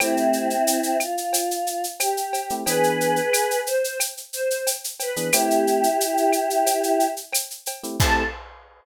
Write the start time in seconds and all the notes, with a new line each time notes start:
0.00 A3 C4 E4 G4, cowbell, claves, shaker
0.17 shaker
0.33 shaker
0.50 shaker
0.67 shaker
0.83 shaker
1.00 F4, claves, shaker
1.18 shaker
1.33 cowbell, shaker
1.51 shaker
1.67 shaker
1.84 shaker
2.00 G4, cowbell, claves, shaker
2.17 shaker
2.33 cowbell, shaker
2.50 A3 C4 E4 G4, shaker
2.65 E3 B3 D4 G#4 B4, cowbell, shaker
2.83 shaker
3.01 shaker
3.16 shaker
3.33 claves, shaker
3.51 shaker
3.66 C5, shaker
3.84 shaker
4.00 cowbell, claves, shaker
4.17 shaker
4.33 C5, shaker
4.50 shaker
4.67 cowbell, shaker
4.84 shaker
5.00 B4, cowbell, shaker
5.16 E3 B3 D4 G#4, shaker
5.33 A3 C4 E4 G4, cowbell, claves, shaker
5.50 shaker
5.67 shaker
5.83 shaker
6.00 shaker
6.17 shaker
6.33 claves, shaker
6.50 shaker
6.66 cowbell, shaker
6.83 shaker
7.00 shaker
7.17 shaker
7.33 cowbell, claves, shaker
7.50 shaker
7.66 cowbell, shaker
7.83 A3 C4 E4 G4, shaker
7.99 A3 C4 E4 G4 A4, kick, crash